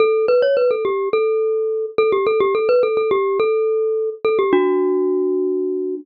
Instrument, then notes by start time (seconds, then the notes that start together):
glockenspiel
0.00 A4
0.28 B4
0.42 C#5
0.57 B4
0.71 A4
0.85 G4
1.13 A4
1.98 A4
2.12 G4
2.27 A4
2.40 G4
2.55 A4
2.69 B4
2.83 A4
2.97 A4
3.11 G4
3.40 A4
4.25 A4
4.39 G4
4.53 D4 F#4